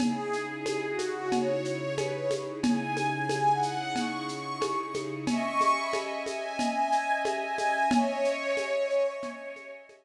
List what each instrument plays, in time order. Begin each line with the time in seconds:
0.00 string ensemble 1 C#3 D#4 E4 G#4, pad 5 (bowed) G#4, cowbell, low conga, shaker
0.33 shaker
0.44 pad 5 (bowed) G#4
0.66 cowbell, high conga, shaker
0.88 pad 5 (bowed) F#4
0.99 high conga, shaker
1.32 pad 5 (bowed) C#5, cowbell, low conga, shaker
1.65 pad 5 (bowed) C#5, shaker
1.98 pad 5 (bowed) B4, cowbell, high conga, shaker
2.14 pad 5 (bowed) C#5
2.31 high conga, shaker
2.63 string ensemble 1 C#3 D#4 E4 G#4, pad 5 (bowed) G#5, cowbell, low conga, shaker
2.97 high conga, shaker
3.07 pad 5 (bowed) G#5
3.29 cowbell, high conga, shaker
3.52 pad 5 (bowed) F#5
3.63 shaker
3.96 pad 5 (bowed) C#6, cowbell, low conga, shaker
4.28 pad 5 (bowed) C#6, shaker
4.61 pad 5 (bowed) C#6, cowbell, high conga, shaker
4.78 pad 5 (bowed) C#6
4.94 high conga, shaker
5.27 string ensemble 1 C#4 D#5 E5 G#5, pad 5 (bowed) C#6, cowbell, low conga, shaker
5.61 high conga, shaker
5.77 pad 5 (bowed) B5
5.93 cowbell, high conga, shaker
6.26 pad 5 (bowed) G#5, high conga, shaker
6.59 pad 5 (bowed) G#5, cowbell, low conga, shaker
6.92 shaker
7.25 pad 5 (bowed) G#5, cowbell, high conga, shaker
7.58 high conga, shaker
7.91 string ensemble 1 C#4 D#5 E5 G#5, pad 5 (bowed) C#5, cowbell, low conga, shaker
8.25 shaker
8.57 cowbell, high conga, shaker
8.90 shaker
9.23 cowbell, low conga, shaker
9.56 high conga, shaker
9.89 cowbell, high conga, shaker